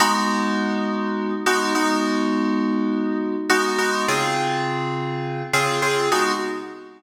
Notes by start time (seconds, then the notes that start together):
0.00 G#3 B3 D#4 F#4
1.46 G#3 B3 D#4 F#4
1.75 G#3 B3 D#4 F#4
3.49 G#3 B3 D#4 F#4
3.78 G#3 B3 D#4 F#4
4.08 C#3 C4 F4 G#4
5.53 C#3 C4 F4 G#4
5.82 C#3 C4 F4 G#4
6.12 G#3 B3 D#4 F#4